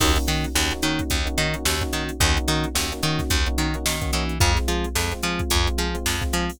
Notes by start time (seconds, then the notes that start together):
0.00 D#2 A#3 C#4 D#4 F#4 A#4 C#5, kick, crash
0.16 A#3 C#4 D#4 F#4, closed hi-hat
0.27 D#3 D#4 F#4 A#4 C#5, snare, closed hi-hat
0.44 closed hi-hat
0.55 D#2 A#3 C#4 D#4 F#4, snare
0.71 A#3 C#4 D#4 F#4, closed hi-hat
0.82 D#3 A#3 C#4 D#4 F#4 A#4 C#5, closed hi-hat
0.99 kick, closed hi-hat
1.10 D#2, kick, closed hi-hat
1.25 A#3 C#4 D#4 F#4, closed hi-hat
1.38 D#3 D#4 F#4 A#4 C#5, closed hi-hat
1.54 A#3 C#4 D#4 F#4, closed hi-hat
1.65 D#2, snare
1.81 A#3 C#4 D#4 F#4, kick, closed hi-hat
1.93 D#3 D#4 F#4 A#4 C#5, closed hi-hat
2.09 closed hi-hat
2.20 D#2 A#3 C#4 D#4 F#4 A#4 C#5, kick, closed hi-hat
2.36 A#3 C#4 D#4 F#4, closed hi-hat
2.48 D#3 D#4 F#4 A#4 C#5, snare, closed hi-hat
2.64 closed hi-hat
2.75 D#2 A#3 C#4 D#4 F#4, snare
2.92 A#3 C#4 D#4 F#4, closed hi-hat
3.02 D#3 A#3 C#4 D#4 F#4 A#4 C#5, closed hi-hat
3.19 kick, snare, closed hi-hat
3.30 D#2, kick, closed hi-hat
3.46 A#3 C#4 D#4 F#4, closed hi-hat
3.58 D#3 D#4 F#4 A#4 C#5, closed hi-hat
3.74 A#3 C#4 D#4 F#4, closed hi-hat
3.86 D#3, snare
4.01 A#3 C#4 D#4 F#4, kick, closed hi-hat
4.13 E3 D#4 F#4 A#4 C#5, closed hi-hat
4.29 closed hi-hat
4.40 F2 G#3 C4 F4 G#4 C5, kick, closed hi-hat
4.56 G#3 C4 F4, snare, closed hi-hat
4.68 F3 F4 G#4 C5, closed hi-hat
4.84 closed hi-hat
4.95 F2 G#3 C4 F4, snare
5.12 G#3 C4 F4, closed hi-hat
5.23 F3 G#3 C4 F4 G#4 C5, closed hi-hat
5.39 kick, closed hi-hat
5.50 F2, kick, closed hi-hat
5.66 G#3 C4 F4, closed hi-hat
5.78 F3 F4 G#4 C5, closed hi-hat
5.94 G#3 C4 F4, closed hi-hat
6.06 F2, snare
6.21 G#3 C4 F4, kick, closed hi-hat
6.33 F3 F4 G#4 C5, closed hi-hat
6.50 open hi-hat